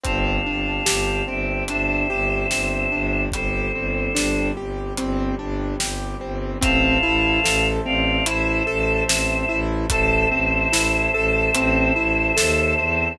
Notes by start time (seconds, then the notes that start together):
0.04 G1 C4 D4 G4 F5 A5, kick, closed hi-hat
0.46 G1 D4
0.86 G1 G4, snare
1.28 G1 C4 E5 G5
1.68 G1 D4 C5 E5, closed hi-hat
2.10 G1 G4
2.51 G1 C4, snare
2.92 G1 D4
3.32 G1 G3 C4 G4 A4 C5, kick, closed hi-hat
3.74 G1 C4
4.15 G1 D4, snare
4.57 G1 G4
4.97 G1 C4, closed hi-hat
5.39 G1 D4
5.80 G1 G4, snare
6.21 G1 C4
6.61 A1 C4 C5 E5 F5 A5, kick, closed hi-hat
7.03 A1 E4
7.44 A1 A4, snare
7.85 A1 C4 D5 F5
8.26 A1 E4 C5 E5, closed hi-hat
8.67 A1 A4
9.08 A1 C4, snare
9.49 A1 E4
9.90 A1 A4 C5 E5 A5, kick, closed hi-hat
10.32 A1 C4
10.73 A1 E4, snare
11.14 A1 A4
11.55 A1 C4, closed hi-hat
11.96 A1 E4
12.37 D#2 A4, snare
12.79 E2 C4